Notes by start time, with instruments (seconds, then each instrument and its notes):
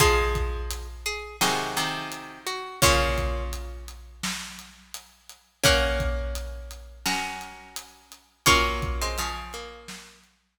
0.00 pizzicato strings F3 G#3 F4 G#4 C5 G#5, kick, closed hi-hat
0.35 kick, closed hi-hat
0.71 closed hi-hat
1.06 pizzicato strings G#4, closed hi-hat
1.41 pizzicato strings C3 D#3 F#4 G#4 D#5, snare
1.76 pizzicato strings C3 D#3, closed hi-hat
2.12 closed hi-hat
2.46 pizzicato strings F#4, closed hi-hat
2.82 pizzicato strings A#2 C#3 A#3 C#4 F4 C#5, kick, closed hi-hat
3.18 kick, closed hi-hat
3.53 closed hi-hat
3.88 closed hi-hat
4.23 snare
4.59 closed hi-hat
4.94 closed hi-hat
5.29 closed hi-hat
5.64 pizzicato strings A#3 C#4 A#4 F#5, kick, closed hi-hat
6.00 kick, closed hi-hat
6.35 closed hi-hat
6.71 closed hi-hat
7.06 pizzicato strings C#4 F#4 A#4, snare
7.41 closed hi-hat
7.76 closed hi-hat
8.12 closed hi-hat
8.46 pizzicato strings F#3 A#3 C#4 F4 C#5, kick, closed hi-hat
8.82 kick, closed hi-hat
9.01 pizzicato strings G#3 C4
9.18 pizzicato strings C#3 F3, closed hi-hat
9.53 pizzicato strings A#3, closed hi-hat
9.88 snare
10.24 closed hi-hat